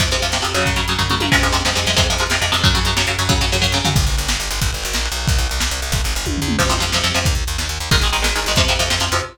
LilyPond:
<<
  \new Staff \with { instrumentName = "Overdriven Guitar" } { \clef bass \time 6/8 \key f \phrygian \tempo 4. = 182 <c f>8 <c f>8 <c f>8 <c f>8 <c f>8 <des ges>8~ | <des ges>8 <des ges>8 <des ges>8 <des ges>8 <des ges>8 <des ges>8 | <c f aes>8 <c f aes>8 <c f aes>8 <c f aes>8 <c f aes>8 <c f aes>8 | <c f aes>8 <c f aes>8 <c f aes>8 <c f aes>8 <c f aes>8 <c f aes>8 |
<des ges>8 <des ges>8 <des ges>8 <des ges>8 <des ges>8 <des ges>8 | <des ges>8 <des ges>8 <des ges>8 <des ges>8 <des ges>8 <des ges>8 | \key g \phrygian r2. | r2. |
r2. | r2. | \key f \phrygian <c f>8 <c f>8 <c f>8 <c f>8 <c f>8 <c f>8 | r2. |
<ees aes>8 <ees aes>8 <ees aes>8 <ees aes>8 <ees aes>8 <ees aes>8 | <c f>8 <c f>8 <c f>8 <c f>8 <c f>8 <c f>8 | }
  \new Staff \with { instrumentName = "Electric Bass (finger)" } { \clef bass \time 6/8 \key f \phrygian f,8 f,8 f,8 f,8 f,8 f,8 | ges,8 ges,8 ges,8 ges,8 ges,8 ges,8 | f,8 f,8 f,8 f,8 f,8 f,8 | f,8 f,8 f,8 f,8 f,8 f,8 |
ges,8 ges,8 ges,8 ges,8 ges,8 ges,8 | ges,8 ges,8 ges,8 ges,8 ges,8 ges,8 | \key g \phrygian g,,8 g,,8 g,,8 g,,8 g,,8 g,,8 | aes,,8 aes,,8 aes,,8 bes,,8. b,,8. |
c,8 c,8 c,8 c,8 c,8 c,8 | g,,8 g,,8 g,,8 ees,8. e,8. | \key f \phrygian f,8 f,8 f,8 f,8 f,8 f,8 | ees,8 ees,8 ees,8 ees,8 ees,8 ees,8 |
aes,,8 aes,,8 aes,,8 aes,,8 aes,,8 aes,,8 | f,8 f,8 f,8 f,8 f,8 f,8 | }
  \new DrumStaff \with { instrumentName = "Drums" } \drummode { \time 6/8 <cymc bd>8 hh8 hh8 sn8 hh8 hh8 | <hh bd>8 hh8 hh8 <bd tomfh>8 toml8 tommh8 | <cymc bd>8 hh8 hh8 sn8 hh8 hh8 | <hh bd>8 hh8 hh8 sn8 hh8 hh8 |
<hh bd>8 hh8 hh8 sn8 hh8 hh8 | <hh bd>8 hh8 hh8 bd8 sn8 tomfh8 | <cymc bd>8 cymr8 cymr8 sn8 cymr8 cymr8 | <bd cymr>8 cymr8 cymr8 sn8 cymr8 cymr8 |
<bd cymr>8 cymr8 cymr8 sn8 cymr8 cymr8 | <bd cymr>8 cymr8 cymr8 <bd tommh>8 tomfh8 toml8 | <cymc bd>8 hh8 hh8 sn8 hh8 hh8 | <hh bd>8 hh8 hh8 sn8 hh8 hh8 |
<hh bd>8 hh8 hh8 sn8 hh8 hh8 | <hh bd>8 hh8 hh8 sn8 hh8 hh8 | }
>>